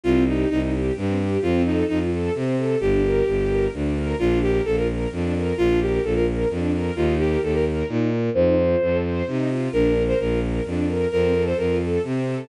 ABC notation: X:1
M:3/4
L:1/16
Q:1/4=130
K:Bb
V:1 name="Violin"
F2 E2 E z7 | F2 E2 E z7 | G8 z4 | F2 G2 A B z6 |
F2 G2 A B z6 | F2 G2 A B z6 | c6 z6 | B3 c B2 z6 |
B3 c B2 z6 |]
V:2 name="String Ensemble 1"
C2 G2 E2 G2 C2 G2 | C2 A2 F2 A2 C2 A2 | D2 B2 G2 B2 D2 B2 | D2 B2 F2 B2 D2 B2 |
D2 B2 F2 B2 D2 B2 | E2 B2 G2 B2 E2 B2 | E2 F2 A2 c2 E2 F2 | D2 B2 F2 B2 D2 B2 |
C2 A2 F2 A2 C2 A2 |]
V:3 name="Violin" clef=bass
C,,4 C,,4 G,,4 | F,,4 F,,4 C,4 | G,,,4 G,,,4 D,,4 | B,,,4 B,,,4 F,,4 |
B,,,4 B,,,4 F,,4 | E,,4 E,,4 B,,4 | F,,4 F,,4 C,4 | B,,,4 B,,,4 F,,4 |
F,,4 F,,4 C,4 |]